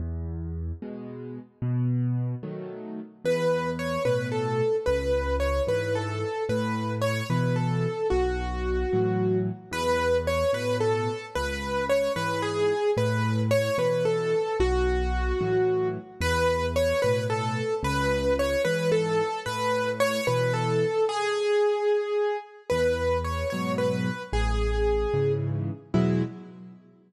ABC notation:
X:1
M:6/8
L:1/8
Q:3/8=74
K:E
V:1 name="Acoustic Grand Piano"
z6 | z6 | B2 c B A2 | B2 c B A2 |
B2 c B A2 | F5 z | B2 c B A2 | B2 c B G2 |
B2 c B A2 | F5 z | B2 c B A2 | B2 c B A2 |
B2 c B A2 | G5 z | B2 c c B2 | G4 z2 |
E3 z3 |]
V:2 name="Acoustic Grand Piano"
E,,3 [B,,G,]3 | B,,3 [D,F,A,]3 | E,,3 [A,,B,,]3 | C,,3 [G,,E,]3 |
A,,3 [B,,E,]3 | B,,,3 [A,,E,F,]3 | E,,3 [A,,B,,]3 | C,,3 [G,,E,]3 |
A,,3 [B,,E,]3 | B,,,3 [A,,E,F,]3 | E,,3 [A,,B,,]3 | C,,3 [G,,E,]3 |
A,,3 [B,,E,]3 | z6 | E,,3 [G,,B,,F,]3 | A,,,3 [G,,C,E,]3 |
[E,,B,,F,G,]3 z3 |]